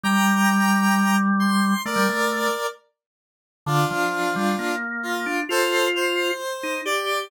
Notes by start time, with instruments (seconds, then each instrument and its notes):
0.04 drawbar organ G3, lead 1 (square) G5 A#5
1.40 lead 1 (square) C6
1.85 drawbar organ A3, lead 1 (square) A#4 D5
1.96 drawbar organ G3
2.09 drawbar organ A3
3.66 drawbar organ D3, lead 1 (square) D4 F4
3.91 drawbar organ F3
4.36 drawbar organ G3
4.59 drawbar organ A#3
5.03 lead 1 (square) F4
5.26 drawbar organ D4
5.49 drawbar organ F4, lead 1 (square) A4 C5
5.95 lead 1 (square) C5
6.63 drawbar organ D#4
6.85 drawbar organ G4, lead 1 (square) D5